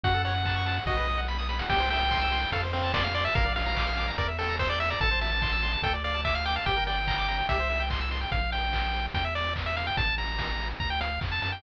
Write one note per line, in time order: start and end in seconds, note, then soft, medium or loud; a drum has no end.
0.03 0.80 F#2 loud
0.03 0.13 F#4 loud
0.03 0.22 F#5 medium
0.03 kick medium
0.03 closed hi-hat loud
0.14 0.24 A4 medium
0.24 0.34 C#5 medium
0.24 0.84 F#5 medium
0.24 open hi-hat medium
0.35 0.44 F#5 medium
0.45 0.55 A5 medium
0.45 kick medium
0.45 clap medium
0.56 0.65 C#6 medium
0.66 0.75 A5 medium
0.66 open hi-hat medium
0.76 0.86 F#5 medium
0.86 1.62 B1 loud
0.86 0.96 F#4 loud
0.86 1.21 D#5 medium
0.86 kick medium
0.86 snare medium
0.97 1.06 B4 medium
1.07 1.17 D#5 medium
1.07 snare medium
1.18 1.27 F#5 medium
1.28 1.37 B5 medium
1.28 snare medium
1.39 1.48 D#6 medium
1.39 snare medium
1.49 1.58 B5 medium
1.49 snare medium
1.59 1.69 F#5 medium
1.59 snare loud
1.69 2.46 C2 loud
1.69 1.79 G4 loud
1.69 1.89 G5 medium
1.69 kick medium
1.69 crash loud
1.80 1.89 C5 medium
1.90 2.00 E5 medium
1.90 2.51 G5 medium
1.90 open hi-hat medium
2.01 2.10 G5 medium
2.11 2.20 C6 loud
2.11 kick medium
2.11 clap medium
2.21 2.31 E6 loud
2.32 2.41 C6 medium
2.32 open hi-hat medium
2.42 2.51 G5 medium
2.52 3.28 F2 loud
2.52 2.62 A4 loud
2.52 2.62 F5 medium
2.52 kick medium
2.52 closed hi-hat loud
2.63 2.72 C5 medium
2.73 2.92 C4 medium
2.73 2.82 F5 medium
2.73 open hi-hat medium
2.83 2.93 A5 medium
2.94 3.04 D5 medium
2.94 3.03 C6 medium
2.94 kick medium
2.94 snare loud
3.04 3.14 F5 medium
3.04 3.13 F6 medium
3.14 3.24 D5 medium
3.14 3.24 C6 medium
3.14 open hi-hat medium
3.25 3.34 E5 medium
3.25 3.34 A5 medium
3.35 4.11 A#1 loud
3.35 3.44 A#4 loud
3.35 3.53 F5 medium
3.35 kick loud
3.35 closed hi-hat medium
3.45 3.55 D5 medium
3.56 3.65 F5 medium
3.56 4.10 F5 medium
3.56 open hi-hat medium
3.66 3.75 A#5 loud
3.76 3.86 D6 medium
3.76 kick medium
3.76 clap loud
3.87 3.96 F6 medium
3.97 4.06 D6 medium
3.97 open hi-hat medium
4.07 4.17 A#5 medium
4.18 4.94 E2 loud
4.18 4.27 A#4 loud
4.18 4.28 D5 medium
4.18 kick medium
4.18 closed hi-hat medium
4.28 4.37 E5 medium
4.39 4.56 A4 medium
4.39 4.48 G5 medium
4.39 open hi-hat medium
4.49 4.58 A#5 medium
4.59 4.69 C5 medium
4.59 4.69 E6 medium
4.59 kick medium
4.59 snare medium
4.69 4.79 D5 medium
4.69 4.79 G6 medium
4.80 4.90 E5 medium
4.80 4.89 E6 medium
4.80 open hi-hat medium
4.90 5.00 D5 medium
4.90 5.00 A#5 medium
5.01 5.77 A1 loud
5.01 5.10 A4 loud
5.01 5.20 A5 medium
5.01 kick medium
5.01 closed hi-hat medium
5.11 5.20 C5 medium
5.21 5.31 E5 medium
5.21 5.82 A5 medium
5.21 open hi-hat medium
5.32 5.41 A5 medium
5.42 5.51 C6 medium
5.42 kick medium
5.42 clap medium
5.52 5.62 E6 medium
5.63 5.72 C6 medium
5.63 open hi-hat medium
5.73 5.82 A5 medium
5.82 6.59 D2 loud
5.82 5.93 A4 loud
5.82 5.93 G5 medium
5.82 kick medium
5.82 closed hi-hat loud
5.94 6.03 D5 medium
6.04 6.21 D5 medium
6.04 6.13 F5 medium
6.04 open hi-hat medium
6.14 6.24 A5 medium
6.25 6.34 E5 medium
6.25 6.34 D6 medium
6.25 kick medium
6.25 clap medium
6.35 6.45 F5 medium
6.35 6.44 F6 medium
6.45 6.55 G5 medium
6.45 6.55 D6 medium
6.45 open hi-hat medium
6.56 6.66 F5 medium
6.56 6.65 A5 medium
6.66 7.42 G1 loud
6.66 6.75 G4 loud
6.66 6.84 G5 medium
6.66 kick medium
6.66 closed hi-hat medium
6.76 6.86 A#4 medium
6.87 6.96 D5 medium
6.87 7.46 G5 medium
6.87 open hi-hat medium
6.97 7.06 G5 medium
7.07 7.17 A#5 loud
7.07 kick medium
7.07 clap loud
7.18 7.27 D6 medium
7.28 7.37 A#5 medium
7.28 open hi-hat medium
7.39 7.48 G5 medium
7.49 8.25 C2 loud
7.49 7.58 G4 loud
7.49 7.83 E5 medium
7.49 kick medium
7.49 closed hi-hat loud
7.59 7.69 C5 medium
7.70 7.79 E5 medium
7.70 open hi-hat medium
7.80 7.89 G5 loud
7.90 8.00 C6 medium
7.90 kick medium
7.90 clap loud
8.01 8.10 E6 medium
8.11 8.20 C6 medium
8.11 open hi-hat medium
8.21 8.31 G5 loud
8.32 9.08 A#1 loud
8.32 8.51 F5 medium
8.32 kick medium
8.32 closed hi-hat medium
8.52 9.06 G5 medium
8.52 open hi-hat medium
8.73 kick medium
8.73 clap loud
8.94 open hi-hat medium
9.14 9.90 E2 loud
9.14 9.24 G5 medium
9.14 kick medium
9.14 closed hi-hat loud
9.25 9.34 E5 medium
9.35 9.54 D5 medium
9.35 open hi-hat medium
9.56 kick medium
9.56 clap loud
9.66 9.76 E5 medium
9.76 9.86 F5 medium
9.76 open hi-hat medium
9.87 9.97 G5 medium
9.97 10.74 A1 medium
9.97 10.15 A5 medium
9.97 kick loud
9.97 closed hi-hat loud
10.18 10.69 A#5 medium
10.18 open hi-hat medium
10.39 kick medium
10.39 snare loud
10.59 open hi-hat medium
10.80 11.19 D2 medium
10.80 10.90 A#5 medium
10.80 kick medium
10.90 11.00 G5 medium
11.01 11.20 F5 medium
11.01 closed hi-hat loud
11.21 11.40 F2 medium
11.21 kick medium
11.21 clap loud
11.32 11.41 A5 medium
11.42 11.61 F#2 medium
11.42 11.52 A5 medium
11.42 open hi-hat medium
11.52 11.62 G5 medium